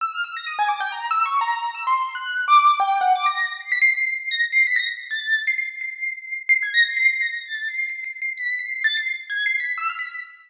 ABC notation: X:1
M:6/4
L:1/16
Q:1/4=129
K:none
V:1 name="Acoustic Grand Piano"
e' f' e' ^a' ^d' ^g =d' =g (3^a2 e'2 ^c'2 a3 e' (3=c'4 ^f'4 d'4 | g2 ^f d' ^a'3 c'' b' c'' c''2 c'' a' z c'' b' a' z2 =a'3 c'' | c''2 c''6 c'' ^g' ^a' c'' c'' c'' a'2 =a'2 c''2 (3c''2 c''2 c''2 | b'2 c''2 a' c'' z2 (3^g'2 c''2 b'2 e' f' b'2 z8 |]